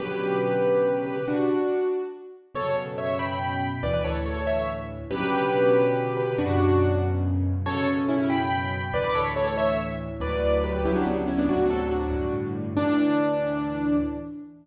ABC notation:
X:1
M:6/8
L:1/16
Q:3/8=94
K:Bm
V:1 name="Acoustic Grand Piano"
[GB]10 [GB]2 | [DF]6 z6 | [Ac]2 z2 [ce]2 [gb]6 | [Bd] [Bd] [Ac] z [Ac] [Ac] [ce]2 z4 |
[GB]10 [GB]2 | [DF]6 z6 | [Ac]2 z2 [CE]2 [gb]6 | [Bd] [bd'] [Ac] z [Ac] [Ac] [ce]2 z4 |
[K:D] [Bd]4 [GB]2 [EG] [DF] [B,D] z [CE] [B,D] | [DF]2 [FA] z [DF]4 z4 | D12 |]
V:2 name="Acoustic Grand Piano" clef=bass
[B,,C,D,F,]12 | z12 | [F,,B,,C,]12 | [D,,A,,E,]12 |
[B,,C,D,F,]12 | [F,,B,,C,]12 | [F,,B,,C,]12 | [D,,A,,E,]12 |
[K:D] [D,,A,,F,]6 [D,,A,,C,F,]6 | [D,,A,,=C,F,]6 [G,,A,,D,]6 | [D,,A,,E,]12 |]